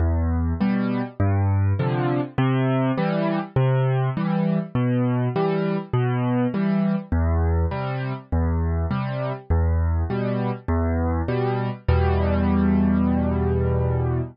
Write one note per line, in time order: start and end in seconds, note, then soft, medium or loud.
0.00 0.53 E2 medium
0.61 1.02 B2 medium
0.61 1.02 G3 medium
1.20 1.73 G2 loud
1.79 2.21 C3 medium
1.79 2.21 D3 medium
1.79 2.21 F3 medium
2.38 2.91 C3 loud
2.98 3.39 E3 medium
2.98 3.39 G3 medium
3.56 4.10 C3 loud
4.17 4.59 E3 medium
4.17 4.59 G3 medium
4.75 5.29 B2 medium
5.36 5.77 E3 medium
5.36 5.77 G3 medium
5.93 6.47 B2 loud
6.54 6.96 E3 medium
6.54 6.96 G3 medium
7.12 7.65 E2 loud
7.71 8.13 C3 medium
7.71 8.13 G3 medium
8.32 8.86 E2 medium
8.91 9.32 C3 medium
8.91 9.32 G3 medium
9.50 10.04 E2 loud
10.10 10.52 B2 medium
10.10 10.52 G3 medium
10.68 11.22 E2 loud
11.28 11.70 B2 medium
11.28 11.70 G3 medium
11.88 14.21 E2 loud
11.88 14.21 B2 medium
11.88 14.21 G3 medium